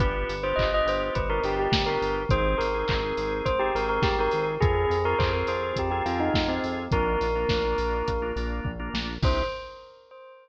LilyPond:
<<
  \new Staff \with { instrumentName = "Tubular Bells" } { \time 4/4 \key c \minor \tempo 4 = 104 b'8. c''16 ees''16 ees''16 c''8 b'16 bes'16 g'16 g'8 bes'8 r16 | c''8 bes'4. c''16 g'16 bes'16 bes'16 g'16 bes'8 r16 | aes'8. bes'16 c''16 bes'16 c''8 g'16 g'16 f'16 ees'8 c'8 r16 | bes'2~ bes'8 r4. |
c''4 r2. | }
  \new Staff \with { instrumentName = "Drawbar Organ" } { \time 4/4 \key c \minor <b d' f' g'>8. <b d' f' g'>16 <b d' f' g'>16 <b d' f' g'>4 <b d' f' g'>16 <b d' f' g'>8. <b d' f' g'>8. | <c' ees' aes'>8. <c' ees' aes'>16 <c' ees' aes'>16 <c' ees' aes'>4 <c' ees' aes'>16 <c' ees' aes'>8. <c' ees' aes'>8. | <c' f' aes'>8. <c' f' aes'>16 <c' f' aes'>16 <c' f' aes'>4 <c' f' aes'>16 <c' f' aes'>8. <c' f' aes'>8. | <bes d' f'>8. <bes d' f'>16 <bes d' f'>16 <bes d' f'>4 <bes d' f'>16 <bes d' f'>8. <bes d' f'>8. |
<c' d' ees' g'>4 r2. | }
  \new Staff \with { instrumentName = "Synth Bass 1" } { \clef bass \time 4/4 \key c \minor g,,8 g,,8 g,,8 g,,8 g,,8 g,,8 g,,8 g,,8 | aes,,8 aes,,8 aes,,8 aes,,8 aes,,8 aes,,8 aes,,8 aes,,8 | f,8 f,8 f,8 f,8 f,8 f,8 f,8 f,8 | bes,,8 bes,,8 bes,,8 bes,,8 bes,,8 bes,,8 bes,,8 bes,,8 |
c,4 r2. | }
  \new DrumStaff \with { instrumentName = "Drums" } \drummode { \time 4/4 <hh bd>8 hho8 <hc bd>8 hho8 <hh bd>8 hho8 <bd sn>8 hho8 | <hh bd>8 hho8 <hc bd>8 hho8 <hh bd>8 hho8 <bd sn>8 hho8 | <hh bd>8 hho8 <hc bd>8 hho8 <hh bd>8 hho8 <bd sn>8 hho8 | <hh bd>8 hho8 <bd sn>8 hho8 <hh bd>8 hho8 bd8 sn8 |
<cymc bd>4 r4 r4 r4 | }
>>